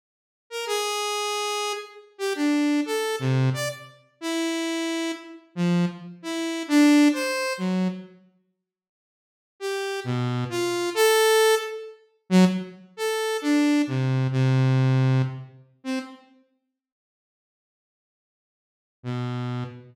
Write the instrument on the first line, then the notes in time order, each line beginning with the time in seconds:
lead 2 (sawtooth)
0.50 A#4
0.66 G#4
2.18 G4
2.35 D4
2.86 A4
3.19 C3
3.53 D5
4.21 E4
5.55 F3
6.22 E4
6.68 D4
7.13 C5
7.58 F#3
9.60 G4
10.04 B2
10.49 F4
10.94 A4
12.30 F#3
12.97 A4
13.41 D4
13.87 C3
14.31 C3
15.84 C4
19.03 B2